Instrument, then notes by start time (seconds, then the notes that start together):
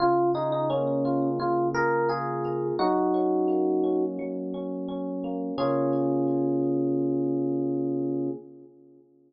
electric piano 1
0.00 C#3 F4
0.34 D#4 G#4
0.52 D#4
0.70 A#3 C#4
1.05 F4
1.40 C#3 F4
1.74 G#4 A#4
2.09 F4 G#4
2.45 A#3
2.79 F#3 D#4 F#4
3.14 C#4
3.48 A#3
3.84 C#4
4.19 F#3
4.54 C#4
4.89 C#4
5.24 A#3
5.58 C#3 A#3 C#4 F4 G#4